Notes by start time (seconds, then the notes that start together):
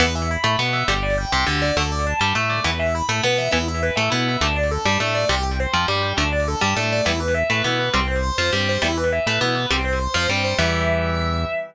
0.00 E2 E3 B3 B4
0.15 E5
0.31 B5
0.44 A2 A3 B5
0.59 B2 B3 B4
0.73 E5
0.88 G1 D3 G3 G4
1.03 D5
1.18 G5
1.32 C2 C3 G5
1.46 D2 D3 G4
1.62 D5
1.76 D2 D3 A3 A4
1.92 D5
2.06 A5
2.20 G2 G3 A5
2.35 A2 A3 A4
2.49 D5
2.64 E2 E3 B3 B4
2.79 E5
2.95 B5
3.09 A2 A3 B5
3.23 B2 B3 B4
3.38 E5
3.51 E2 E3 B3 E4
3.68 E5
3.83 B4
3.96 A2 A3 E5
4.10 B2 B3 E4
4.28 E5
4.41 D2 D3 A3 D4
4.56 D5
4.71 A4
4.85 G2 G3 A5
5.00 A2 A3 D4
5.14 D5
5.29 C2 C3 G3 G4
5.43 G5
5.60 C5
5.73 F2 F3 G5
5.88 G2 G3 G4
6.03 G5
6.17 D2 D3 A3 D4
6.32 D5
6.48 A4
6.61 G2 G3 A5
6.76 A2 A3 D4
6.92 D5
7.05 E2 E3 G3 B3 E4
7.20 B4
7.34 E5
7.50 A2 A3 B4
7.64 B2 B3 E4
7.79 B4
7.94 C2 G3 C4
8.07 C5
8.23 C5
8.38 F2 F3 C5
8.53 G2 G3 C4
8.69 C5
8.82 E2 E3 G3 B3 E4
8.97 B4
9.12 E5
9.26 A2 A3 B4
9.41 B2 B3 E4
9.55 B4
9.71 C2 G3 C4
9.85 C5
9.99 C5
10.14 F2 F3 C5
10.29 G2 G3 C4
10.44 C5
10.58 E2 E3 G3 B3 E5